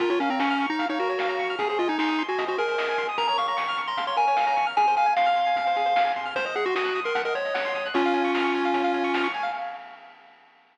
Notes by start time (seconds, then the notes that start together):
0.00 A#1 F4 A#4, kick, closed hi-hat
0.10 F4 C#5, closed hi-hat
0.20 A#1 C#4 F5, closed hi-hat
0.30 C4 A#5, closed hi-hat
0.39 A#1 C#4 C#6, snare
0.50 F6, closed hi-hat
0.59 A#1 C#6, closed hi-hat
0.70 D#4 A#5
0.79 A#1 F5, kick, closed hi-hat
0.89 D#4 C#5, closed hi-hat
0.99 A#1 F#4 A#4, closed hi-hat
1.09 C#5, closed hi-hat
1.19 A#1 F5, snare
1.29 A#5, closed hi-hat
1.39 A#1 C#6, kick, closed hi-hat
1.49 F6, closed hi-hat
1.59 G#1 G#4, kick, closed hi-hat
1.69 G#4 C5, closed hi-hat
1.79 G#1 F4 D#5, closed hi-hat
1.88 D#4 G#5, closed hi-hat
1.99 G#1 D#4 C6, snare
2.08 D#6, closed hi-hat
2.18 G#1 C6, closed hi-hat
2.28 F#4 G#5, closed hi-hat
2.38 G#1 D#5, kick, closed hi-hat
2.47 F#4 C5, closed hi-hat
2.58 G#1 G#4 A#4, closed hi-hat
2.68 C5, closed hi-hat
2.78 G#1 D#5, snare
2.88 G#5, closed hi-hat
2.98 G#1 C6, kick, closed hi-hat
3.08 D#6, closed hi-hat
3.18 A#1 A#4 A#5, kick, closed hi-hat
3.28 C#5 A#5, closed hi-hat
3.38 A#1 F5 C#6, closed hi-hat
3.47 A#5 C#6, closed hi-hat
3.57 A#1 C#6, snare
3.68 F6, closed hi-hat
3.77 A#1 C#6, closed hi-hat
3.88 A#5 C6, closed hi-hat
3.97 A#1 F5, kick, closed hi-hat
4.07 C#5 C6, closed hi-hat
4.17 A#1 A#4 G#5, closed hi-hat
4.27 C#5, closed hi-hat
4.37 A#1 F5, snare
4.47 A#5, closed hi-hat
4.56 A#1 C#6, kick, closed hi-hat
4.67 F6, closed hi-hat
4.77 F2 G#4 G#5, kick, closed hi-hat
4.87 C5, closed hi-hat
4.96 F2 F5 G#5, closed hi-hat
5.06 G#5, closed hi-hat
5.16 F2 F5 C6, snare
5.26 F6, closed hi-hat
5.36 F2 C6, closed hi-hat
5.46 G#5, closed hi-hat
5.56 F2 F5, kick, closed hi-hat
5.66 C5, closed hi-hat
5.76 F2 G#4, closed hi-hat
5.86 C5, closed hi-hat
5.96 F2 F5, snare
6.05 G#5, closed hi-hat
6.16 F2 C6, kick, closed hi-hat
6.25 F6, closed hi-hat
6.35 C2 C5, kick, closed hi-hat
6.45 C5 D#5, kick, closed hi-hat
6.55 C2 G#4 F#5, closed hi-hat
6.65 F#4 C6, closed hi-hat
6.75 C2 F#4 D#6, snare
6.85 F#6, closed hi-hat
6.95 C2 D#6, closed hi-hat
7.04 A#4 C6, closed hi-hat
7.15 C2 F#5, kick, closed hi-hat
7.25 A#4 D#5, closed hi-hat
7.35 C2 C5 C#5, closed hi-hat
7.45 D#5, closed hi-hat
7.54 C2 F#5, snare
7.65 C6, closed hi-hat
7.75 C2 D#6, kick, closed hi-hat
7.85 F#6, closed hi-hat
7.94 C#2 C#4 F4 C#5, kick, closed hi-hat
8.04 F5, closed hi-hat
8.14 C#2 G#5, closed hi-hat
8.24 C#6, closed hi-hat
8.34 C#2 F6, snare
8.44 C#6, closed hi-hat
8.54 C#2 G#5, closed hi-hat
8.64 F5, closed hi-hat
8.73 C#2 C#5, kick, closed hi-hat
8.84 F5, closed hi-hat
8.93 C#2 G#5, closed hi-hat
9.04 C#6, closed hi-hat
9.14 C#2 F6, snare
9.24 C#6, closed hi-hat
9.34 C#2 G#5, closed hi-hat
9.43 F5, open hi-hat